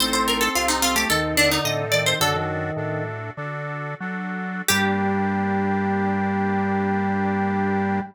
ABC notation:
X:1
M:4/4
L:1/16
Q:1/4=109
K:Gm
V:1 name="Harpsichord"
c c B A F E F G A2 D E e2 d c | "^rit." A12 z4 | G16 |]
V:2 name="Drawbar Organ"
C6 C A, E,2 D,4 E,2 | "^rit." D, E,5 z10 | G,16 |]
V:3 name="Accordion"
[CEA]4 [CEA]4 [CEA]4 [CEA]4 | "^rit." [D^FA]4 [DFA]4 [DFA]4 [DFA]4 | [B,DG]16 |]
V:4 name="Drawbar Organ" clef=bass
A,,,4 C,,4 E,,4 A,,4 | "^rit." ^F,,4 A,,4 D,4 ^F,4 | G,,16 |]